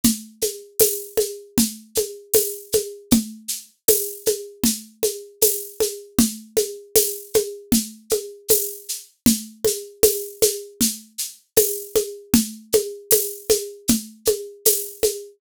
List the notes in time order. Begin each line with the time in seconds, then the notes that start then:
0.04 low conga, shaker
0.42 high conga, shaker
0.79 tambourine, high conga, shaker
1.17 high conga, shaker
1.58 low conga, shaker
1.95 high conga, shaker
2.34 tambourine, high conga, shaker
2.72 high conga, shaker
3.11 low conga, shaker
3.48 shaker
3.88 tambourine, high conga, shaker
4.26 high conga, shaker
4.64 low conga, shaker
5.03 high conga, shaker
5.42 tambourine, high conga, shaker
5.80 high conga, shaker
6.19 low conga, shaker
6.57 high conga, shaker
6.96 tambourine, high conga, shaker
7.34 high conga, shaker
7.72 low conga, shaker
8.10 high conga, shaker
8.48 tambourine, high conga, shaker
8.89 shaker
9.26 low conga, shaker
9.65 high conga, shaker
10.03 tambourine, high conga, shaker
10.42 high conga, shaker
10.81 low conga, shaker
11.18 shaker
11.57 tambourine, high conga, shaker
11.95 high conga, shaker
12.34 low conga, shaker
12.73 high conga, shaker
13.11 tambourine, high conga, shaker
13.50 high conga, shaker
13.88 low conga, shaker
14.25 high conga, shaker
14.65 tambourine, high conga, shaker
15.03 high conga, shaker